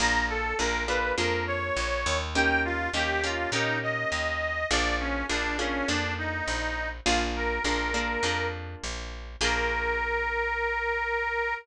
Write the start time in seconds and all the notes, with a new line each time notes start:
0.00 A#1 A#3 D4 F4 G#4 A#5
0.29 A4
0.59 A#1 A#3 D4 F4 G#4 A#4
0.88 A#3 D4 F4 G#4 B4
1.18 F2 A#3 D4 F4 G#4 A#4
1.47 C#5
1.76 A#1
2.06 D#2
2.35 A#3 C#4 D#4 G4 G5
2.65 F4
2.94 D#2 A#3 C#4 D#4 G4
3.24 A#3 C#4 D#4 F4 G4
3.52 A#2 A#3 C#4 D#4 G4
3.83 D#5
4.12 D#2
4.70 A#1 A#3 D4 F4 G#4 D5
5.00 C#4
5.29 A#1 A#3 D4 F4 G#4
5.59 A#3 C#4 D4 F4 G#4
5.88 F2 A#3 D4 F4 G#4
6.18 D#4
6.48 A#1
7.06 A#1 A#3 D4 F4 G#4
7.36 A#4
7.64 A#1 A#3 D4 F4 G#4
7.94 A#3 D4 F4 G#4
8.23 F2 A#3 D4 F4 G#4
8.84 A#1
9.41 A#1 A#3 D4 F4 G#4 A#4